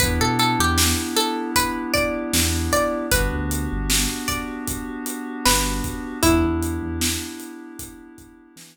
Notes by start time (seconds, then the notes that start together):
0.00 E2 B3 D4 E4 G4 B4, kick, closed hi-hat
0.21 B2 A4
0.39 A4, closed hi-hat
0.59 E2 G4
0.78 snare
1.16 A4, closed hi-hat
1.56 B4, kick, closed hi-hat
1.94 D5, kick, closed hi-hat
2.33 E2, snare
2.72 D5, kick, closed hi-hat
3.12 G1 B3 D4 F#4 G4 B4, kick, closed hi-hat
3.33 D2
3.51 closed hi-hat
3.72 G1
3.90 snare
4.28 D5, kick, closed hi-hat
4.68 kick, closed hi-hat
5.06 closed hi-hat
5.45 G1 B4, snare
5.84 kick, closed hi-hat
6.23 E2 B3 D4 E4 G4, kick, closed hi-hat
6.44 E2
6.63 closed hi-hat
6.83 E2
7.01 snare
7.40 closed hi-hat
7.79 kick, closed hi-hat
8.18 kick, closed hi-hat
8.56 E3, snare